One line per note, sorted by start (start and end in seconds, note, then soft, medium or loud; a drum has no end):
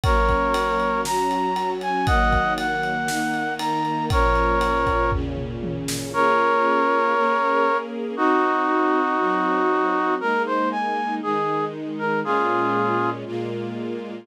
0.04 1.04 F#3 medium
0.04 1.04 A#3 medium
0.04 1.04 C#4 medium
0.04 1.01 A#4 medium
0.04 1.01 C#5 medium
0.04 kick loud
0.04 ride loud
0.29 kick medium
0.29 ride medium
0.54 ride loud
0.80 ride medium
1.05 2.06 F#3 medium
1.05 2.06 C#4 medium
1.05 2.06 F#4 medium
1.05 1.70 A#5 medium
1.05 snare medium
1.31 ride medium
1.56 ride medium
1.81 2.06 G#5 medium
1.81 ride medium
2.06 3.08 D#3 medium
2.06 3.08 F#3 medium
2.06 3.08 A#3 medium
2.06 2.53 D#5 medium
2.06 2.53 F#5 medium
2.06 kick loud
2.06 ride medium
2.32 kick medium
2.32 ride medium
2.58 3.54 F#5 medium
2.58 ride medium
2.83 ride medium
3.08 4.09 D#3 medium
3.08 4.09 A#3 medium
3.08 4.09 D#4 medium
3.08 snare medium
3.34 ride medium
3.59 4.05 A#5 medium
3.59 ride loud
3.85 ride medium
4.10 5.11 A#2 medium
4.10 5.11 F3 medium
4.10 5.11 C#4 medium
4.10 5.11 A#4 medium
4.10 5.11 C#5 medium
4.10 kick loud
4.10 ride loud
4.35 ride medium
4.61 ride medium
4.87 kick medium
4.87 ride medium
5.12 6.13 A#2 medium
5.12 6.13 C#3 medium
5.12 6.13 C#4 medium
5.12 kick medium
5.12 floor tom medium
5.37 mid tom medium
5.63 high tom medium
5.88 snare loud
6.13 7.14 A#3 medium
6.13 7.14 C#4 medium
6.13 7.14 F4 medium
6.13 7.14 G#4 medium
6.13 7.77 A#4 medium
6.13 7.77 C#5 medium
7.15 8.16 A#3 medium
7.15 8.16 C#4 medium
7.15 8.16 G#4 medium
7.15 8.16 A#4 medium
8.17 9.18 C4 medium
8.17 10.15 D#4 medium
8.17 9.18 D#4 medium
8.17 10.15 F#4 medium
8.17 9.18 F#4 medium
9.19 10.20 F#3 medium
9.19 10.20 C4 medium
9.19 10.20 F#4 medium
10.20 11.21 G#3 medium
10.20 11.21 A#3 medium
10.20 11.21 D#4 medium
10.20 10.42 A#4 medium
10.46 10.69 C5 medium
10.71 11.15 G#5 medium
11.22 12.23 D#3 medium
11.22 12.23 G#3 medium
11.22 12.23 D#4 medium
11.22 11.65 G#4 medium
11.99 12.20 A#4 medium
12.24 13.24 A#2 medium
12.24 13.24 G#3 medium
12.24 13.24 C#4 medium
12.24 13.24 F4 medium
12.24 13.10 F4 medium
12.24 13.10 G#4 medium
13.26 14.26 A#2 medium
13.26 14.26 G#3 medium
13.26 14.26 A#3 medium
13.26 14.26 F4 medium